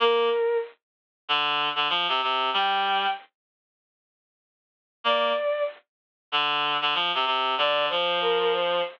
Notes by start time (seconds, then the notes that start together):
0.00 A#3 A#4
1.29 D3
1.75 D3
1.89 F3
2.08 C3
2.22 C3
2.53 G3 G5
5.04 A#3 D5
6.32 D3
6.81 D3
6.94 F3
7.14 C3
7.26 C3
7.58 D3 D5
7.89 F3 C5
8.21 A#4
8.40 A#4
8.53 C5